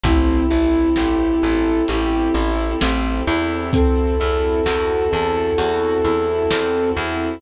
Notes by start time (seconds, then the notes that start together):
0.03 A1 C4 E4 G4 A4, kick, closed hi-hat
0.51 A1 E4
0.96 A1 G4, snare
1.43 A1 A4
1.88 A1 E4 G4, closed hi-hat
2.34 A1 E4
2.81 A1 C4, snare
3.28 E2 E4
3.73 C4 E4 F#4 A4, kick, closed hi-hat
4.20 E2 E4
4.66 E2 F#4, snare
5.12 E2 A4
5.58 E2 F#4, closed hi-hat
6.05 E2 E4
6.51 E2 C4, snare
6.97 E2 E4